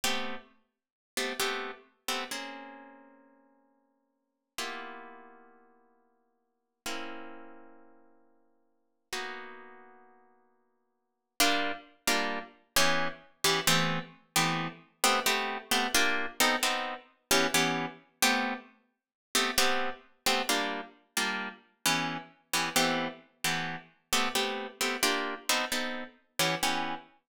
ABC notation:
X:1
M:5/4
L:1/8
Q:1/4=132
K:Gdor
V:1 name="Orchestral Harp"
[A,=B,CG]5 [A,B,CG] [A,B,CG]3 [A,B,CG] | [K:Bbdor] [B,CDA]10 | [B,=B,=EFG]10 | [B,CD=E]10 |
[B,_CE_G]10 | [K:Gdor] [G,B,DF]3 [G,B,DF]3 [E,=B,^CG]3 [E,B,CG] | [E,A,=B,CG]3 [E,A,B,CG]3 [A,B,CG] [A,B,CG]2 [A,B,CG] | [B,DFG]2 [=B,C^DA] [B,CDA]3 [E,B,^CG] [E,B,CG]3 |
[A,=B,CG]5 [A,B,CG] [A,B,CG]3 [A,B,CG] | [G,B,DF]3 [G,B,DF]3 [E,=B,^CG]3 [E,B,CG] | [E,A,=B,CG]3 [E,A,B,CG]3 [A,B,CG] [A,B,CG]2 [A,B,CG] | [B,DFG]2 [=B,C^DA] [B,CDA]3 [E,B,^CG] [E,B,CG]3 |]